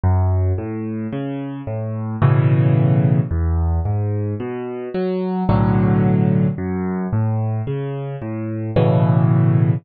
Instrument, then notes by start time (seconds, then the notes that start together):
acoustic grand piano
0.03 F#2
0.58 A2
1.12 C#3
1.67 A2
2.22 A2 B2 C#3 E3
3.31 E2
3.85 G#2
4.40 B2
4.94 F#3
5.49 B1 A2 D3 F#3
6.58 F#2
7.12 A2
7.67 C#3
8.22 A2
8.76 A2 B2 C#3 E3